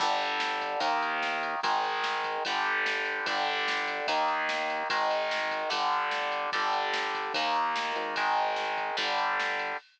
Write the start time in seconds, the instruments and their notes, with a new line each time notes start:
0.00 synth bass 1 G1, overdriven guitar D3 G3, kick, crash
0.20 ride
0.40 snare
0.61 kick, ride
0.80 synth bass 1 D#2, overdriven guitar D#3 A#3, kick, ride
1.02 ride
1.23 snare
1.43 ride
1.63 synth bass 1 G#1, overdriven guitar D#3 G#3, kick, ride
1.84 ride
2.04 snare
2.24 kick, ride
2.45 synth bass 1 G1, overdriven guitar D3 G3, kick, ride
2.65 ride
2.86 snare
3.05 ride
3.26 synth bass 1 G1, overdriven guitar D3 G3, kick, ride
3.46 ride
3.68 snare
3.88 kick, ride
4.07 synth bass 1 D#2, overdriven guitar D#3 A#3, kick, ride
4.28 ride
4.49 snare
4.70 ride
4.90 synth bass 1 G#1, overdriven guitar D#3 G#3, kick, ride
5.11 ride
5.31 snare
5.51 kick, ride
5.70 synth bass 1 G1, overdriven guitar D3 G3, kick, ride
5.92 ride
6.11 snare
6.32 ride
6.52 synth bass 1 G1, overdriven guitar D3 G3, kick, ride
6.73 ride
6.94 snare
7.14 kick, ride
7.34 synth bass 1 D#2, overdriven guitar D#3 A#3, kick, ride
7.55 ride
7.76 snare
7.95 synth bass 1 G#1, ride
8.16 overdriven guitar D#3 G#3, kick, ride
8.37 ride
8.56 snare
8.77 kick, ride
8.97 synth bass 1 G1, overdriven guitar D3 G3, kick, ride
9.18 ride
9.40 snare
9.59 ride